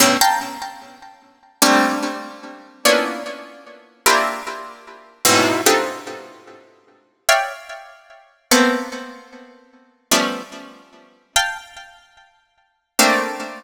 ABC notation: X:1
M:7/8
L:1/16
Q:1/4=74
K:none
V:1 name="Harpsichord"
[G,,A,,B,,_D,] [fga_b] z6 [G,A,_B,C=D]6 | [_B,=B,_D=DEF]6 [_B,CDEFG]2 z4 [_A,,=A,,=B,,C,]2 | [CD_EFGA]8 [_d=d=efg]6 | [A,_B,=B,C]8 [F,G,A,B,_D]4 z2 |
[fga]8 [A,_B,CD]4 z2 |]